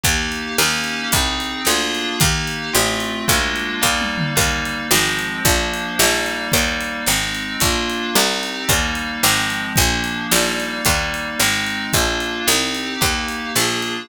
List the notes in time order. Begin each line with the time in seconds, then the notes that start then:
0.03 D#2 A#3 D#4 G4, kick, closed hi-hat
0.32 closed hi-hat
0.58 D#2 A#3 C#4 D#4 G4, snare
0.84 closed hi-hat
1.12 C2 C4 D#4 G#4, kick, closed hi-hat
1.40 closed hi-hat
1.65 D2 A#3 D4 F4 G#4, snare
1.95 closed hi-hat
2.20 D#2 A#3 D#4 G4, kick, closed hi-hat
2.47 closed hi-hat
2.73 A1 A3 C4 F4, snare
3.00 closed hi-hat
3.28 D2 G#3 A#3 D4 F4, kick, closed hi-hat
3.56 closed hi-hat
3.81 D#2 G3 A#3 D#4, kick, snare
4.01 high tom
4.18 mid tom
4.35 D#2 G3 A#3 D#4, kick, closed hi-hat
4.65 closed hi-hat
4.91 G#1 F3 G#3 C4, snare
5.19 closed hi-hat
5.45 A#1 F3 A#3 D4, kick, closed hi-hat
5.74 closed hi-hat
5.99 A#1 G3 A#3 D#4, snare
6.26 closed hi-hat
6.52 D#2 G3 A#3 D#4, kick, closed hi-hat
6.81 closed hi-hat
7.06 G#1 G#3 C4 D#4, snare
7.35 closed hi-hat
7.60 A#1 A#3 D4 F4, kick, closed hi-hat
7.90 closed hi-hat
8.15 C2 C4 D#4 G4, snare
8.43 closed hi-hat
8.68 D#2 G3 A#3 D#4, kick, closed hi-hat
8.95 closed hi-hat
9.23 G#1 F3 G#3 C4, snare
9.50 closed hi-hat
9.76 A#1 F3 A#3 D4, kick, closed hi-hat
10.04 closed hi-hat
10.31 A#1 G3 A#3 D#4, snare
10.60 closed hi-hat
10.85 D#2 G3 A#3 D#4, kick, closed hi-hat
11.14 closed hi-hat
11.39 G#1 G#3 C4 D#4, snare
11.66 closed hi-hat
11.93 A#1 A#3 D4 F4, kick, closed hi-hat
12.20 closed hi-hat
12.47 C2 C4 D#4 G4, snare
12.75 closed hi-hat
13.01 D#2 A#3 D#4 G4, kick, crash
13.28 closed hi-hat
13.55 A#1 A#3 D4 F4 G#4, snare
13.82 closed hi-hat